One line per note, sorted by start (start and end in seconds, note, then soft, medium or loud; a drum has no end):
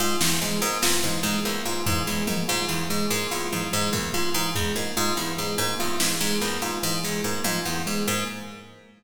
0.00 0.16 G#2 medium
0.00 0.17 F4 medium
0.21 0.38 E2 medium
0.21 0.37 E3 medium
0.21 snare loud
0.41 0.58 G#2 medium
0.41 0.58 G#3 medium
0.41 high tom medium
0.62 0.78 G#2 medium
0.62 0.79 A#3 medium
0.82 0.99 E2 medium
0.82 0.99 F4 medium
0.82 snare loud
1.03 1.20 G#2 medium
1.03 1.20 E3 medium
1.03 kick medium
1.23 1.40 G#2 medium
1.23 1.41 G#3 medium
1.45 1.62 E2 medium
1.45 1.61 A#3 medium
1.45 cowbell medium
1.65 1.82 G#2 medium
1.65 1.82 F4 medium
1.86 2.03 G#2 medium
1.86 2.03 E3 medium
1.86 floor tom loud
2.07 2.24 E2 medium
2.07 2.23 G#3 medium
2.27 2.44 G#2 medium
2.27 2.44 A#3 medium
2.27 high tom loud
2.48 2.65 G#2 medium
2.48 2.65 F4 medium
2.48 kick medium
2.69 2.85 E2 medium
2.69 2.85 E3 medium
2.90 3.07 G#2 medium
2.90 3.06 G#3 medium
3.10 3.27 G#2 medium
3.10 3.27 A#3 medium
3.31 3.48 E2 medium
3.31 3.48 F4 medium
3.52 3.69 G#2 medium
3.52 3.68 E3 medium
3.52 high tom medium
3.72 3.90 G#2 medium
3.72 3.89 G#3 medium
3.72 cowbell medium
3.93 4.09 E2 medium
3.93 4.10 A#3 medium
3.93 kick medium
4.14 4.30 G#2 medium
4.14 4.30 F4 medium
4.34 4.51 G#2 medium
4.34 4.51 E3 medium
4.55 4.72 E2 medium
4.55 4.72 G#3 medium
4.55 floor tom loud
4.76 4.92 G#2 medium
4.76 4.92 A#3 medium
4.97 5.13 G#2 medium
4.97 5.13 F4 medium
5.17 5.34 E2 medium
5.17 5.34 E3 medium
5.38 5.55 G#2 medium
5.38 5.54 G#3 medium
5.58 5.75 G#2 medium
5.58 5.75 A#3 medium
5.58 cowbell medium
5.79 5.96 E2 medium
5.79 5.96 F4 medium
6.00 6.16 G#2 medium
6.00 6.17 E3 medium
6.00 snare loud
6.21 6.37 G#2 medium
6.21 6.37 G#3 medium
6.41 6.58 E2 medium
6.41 6.58 A#3 medium
6.41 clap medium
6.62 6.78 G#2 medium
6.62 6.79 F4 medium
6.83 7.00 G#2 medium
6.83 6.99 E3 medium
7.03 7.21 E2 medium
7.03 7.20 G#3 medium
7.03 snare medium
7.24 7.41 G#2 medium
7.24 7.41 A#3 medium
7.44 7.61 G#2 medium
7.44 7.61 F4 medium
7.44 high tom medium
7.65 7.82 E2 medium
7.65 7.82 E3 medium
7.86 8.03 G#2 medium
7.86 8.03 G#3 medium
8.07 8.24 G#2 medium
8.07 8.23 A#3 medium